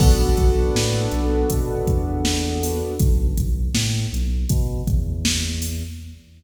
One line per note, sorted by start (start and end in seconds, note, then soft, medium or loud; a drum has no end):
0.00 0.32 B1 medium
0.00 2.94 B3 medium
0.00 2.94 D4 medium
0.00 2.94 F#4 medium
0.00 2.94 A4 medium
0.00 kick loud
0.00 crash loud
0.37 0.69 B1 medium
0.37 kick medium
0.37 snare soft
0.37 closed hi-hat medium
0.75 1.07 A2 medium
0.75 snare loud
1.12 1.44 B1 medium
1.12 closed hi-hat medium
1.50 1.83 B2 medium
1.50 kick medium
1.50 closed hi-hat loud
1.87 2.82 E2 medium
1.87 kick medium
1.87 closed hi-hat medium
2.25 snare loud
2.63 open hi-hat medium
3.00 3.33 B1 medium
3.00 kick loud
3.00 closed hi-hat loud
3.38 3.70 B1 medium
3.38 kick medium
3.38 closed hi-hat medium
3.74 4.06 A2 medium
3.74 snare loud
4.13 4.45 B1 medium
4.13 closed hi-hat medium
4.49 4.82 B2 medium
4.49 kick medium
4.49 closed hi-hat loud
4.87 5.83 E2 medium
4.87 kick medium
4.87 closed hi-hat medium
5.25 snare loud
5.62 open hi-hat medium